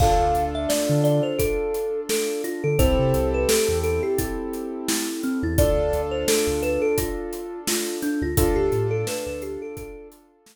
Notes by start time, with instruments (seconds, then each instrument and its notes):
0.00 synth bass 2 D2, acoustic grand piano D4 F4 A4, kalimba F5, kick, crash
0.20 synth bass 2 D2
0.35 synth bass 2 D2, closed hi-hat
0.55 kalimba E5
0.69 kalimba D5, snare
0.89 synth bass 2 D3
1.04 kalimba D5, closed hi-hat
1.23 kalimba C5
1.39 kalimba A4, kick, closed hi-hat
1.74 closed hi-hat
2.09 kalimba A4, snare
2.44 kalimba F4, closed hi-hat
2.64 synth bass 2 D3, kalimba A4
2.79 synth bass 2 C2, acoustic grand piano C4 E4 G4 A4, kalimba C5, kick, closed hi-hat
2.99 synth bass 2 C3
3.14 synth bass 2 C2, closed hi-hat
3.34 kalimba B4
3.49 kalimba A4, snare
3.68 synth bass 2 E2
3.83 kalimba A4, closed hi-hat
4.03 kalimba G4
4.18 kalimba E4, kick, closed hi-hat
4.53 closed hi-hat
4.88 kalimba E4, snare
5.23 kalimba C4, closed hi-hat
5.43 synth bass 2 E2, kalimba E4
5.58 synth bass 2 D2, acoustic grand piano D4 F4 A4, kalimba D5, kick, closed hi-hat
5.77 synth bass 2 D2
5.93 synth bass 2 D2, closed hi-hat
6.11 kalimba C5
6.28 kalimba A4, snare
6.47 synth bass 2 D2
6.62 kalimba B4, closed hi-hat
6.82 kalimba A4
6.98 kalimba F4, kick, closed hi-hat
7.33 closed hi-hat
7.67 kalimba F4, snare
8.02 kalimba D4, snare, closed hi-hat
8.22 synth bass 2 D2, kalimba F4
8.37 synth bass 2 D2, acoustic grand piano D4 F4 A4, kalimba F4, kick, closed hi-hat
8.56 synth bass 2 D2, kalimba G4
8.72 synth bass 2 A2, closed hi-hat
8.91 kalimba A4
9.07 kalimba B4, snare
9.26 synth bass 2 D2, kalimba B4
9.42 kalimba G4, closed hi-hat
9.62 kalimba A4
9.77 kalimba A4, kick, closed hi-hat
10.12 closed hi-hat
10.46 snare